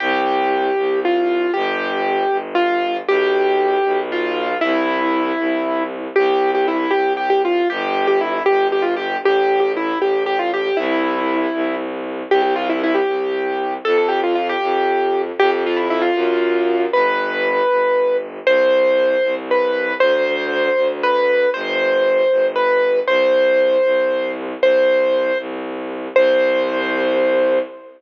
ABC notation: X:1
M:6/8
L:1/16
Q:3/8=78
K:C
V:1 name="Acoustic Grand Piano"
G8 F4 | G8 F4 | G8 F4 | E10 z2 |
G3 G E2 G2 G G F2 | G3 G E2 G2 G F G2 | G3 G E2 G2 G F G2 | E8 z4 |
G G F E E G7 | A A G F F G7 | G G F E E F7 | B10 z2 |
c8 B4 | c8 B4 | c8 B4 | c10 z2 |
c6 z6 | c12 |]
V:2 name="Violin" clef=bass
C,,6 C,,6 | G,,,6 G,,,6 | B,,,6 B,,,6 | C,,6 C,,6 |
C,,6 C,,6 | G,,,6 G,,,6 | A,,,6 A,,,6 | C,,6 C,,6 |
C,,6 C,,6 | F,,6 F,,6 | F,,6 ^F,,6 | G,,,6 G,,,6 |
C,,6 C,,6 | D,,6 D,,6 | G,,,6 G,,,6 | C,,6 C,,6 |
C,,6 C,,6 | C,,12 |]